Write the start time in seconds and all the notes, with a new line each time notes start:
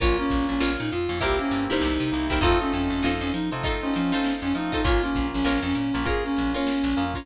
0.00 A#1 A#3 C#4 F4 A#4 C#5, kick, closed hi-hat
0.18 A#3 C#4 F4, snare, closed hi-hat
0.30 A#1, kick, closed hi-hat
0.48 A#1 C#4, closed hi-hat
0.60 A#1 F4 A#4 C#5, snare
0.78 A#2 D#4, closed hi-hat
0.91 F2 F4, closed hi-hat
1.09 F2 A#3 C#4 F4, closed hi-hat
1.20 C2 A#3 C4 E4 G4 A#4 C5, kick, closed hi-hat
1.38 A#3 C4 C#4 E4 G4, closed hi-hat
1.51 G2, closed hi-hat
1.69 G2 D#4 E4 G4 A#4 C5, closed hi-hat
1.81 C2, snare
2.00 C3, closed hi-hat
2.11 C2 A#3 C4 E4 G4, closed hi-hat
2.30 C2 D#4 E4 G4 A#4 C5, kick, closed hi-hat
2.41 F2 A3 C4 D#4 F4 A4 C5, kick, closed hi-hat
2.60 A3 C4 C#4 D#4 F4, snare, closed hi-hat
2.73 F2 C#4, closed hi-hat
2.90 F2, closed hi-hat
3.03 F2 D#4 F4 A4 C5, snare
3.21 F2 C#4, closed hi-hat
3.32 F3 D#4, snare, closed hi-hat
3.51 C3 A3 C4 D#4 F4, closed hi-hat
3.63 D#4 F4 A4 C5, kick, closed hi-hat
3.82 A3 C4 C#4 D#4 F4, closed hi-hat
3.94 F3 C#4, closed hi-hat
4.12 D#4 F4 A4 C5, closed hi-hat
4.24 snare
4.42 F2 C#4, closed hi-hat
4.54 F3 A3 C4 D#4 F4, closed hi-hat
4.72 D#4 F4 A4 C5, kick, closed hi-hat
4.84 A#1 A#3 C#4 F4 A#4 C#5, kick, closed hi-hat
5.02 A#3 C#4 F4, snare, closed hi-hat
5.15 A#1, kick, closed hi-hat
5.33 A#1 C#4, closed hi-hat
5.44 A#1 F4 A#4 C#5, snare
5.63 F2 C#4, closed hi-hat
5.75 A#2 C#4, snare, closed hi-hat
5.94 A#1 A#3 C#4 F4, closed hi-hat
6.06 F4 G#4 A#4 C#5, kick, closed hi-hat
6.24 A#3 C#4 F4, closed hi-hat
6.36 A#1, closed hi-hat
6.54 C#4 F4 A#4 C#5, closed hi-hat
6.67 snare
6.84 A#1, closed hi-hat
6.96 F2 A#3 C#4 F4, closed hi-hat
7.14 C#4 F4 A#4 C#5, kick, closed hi-hat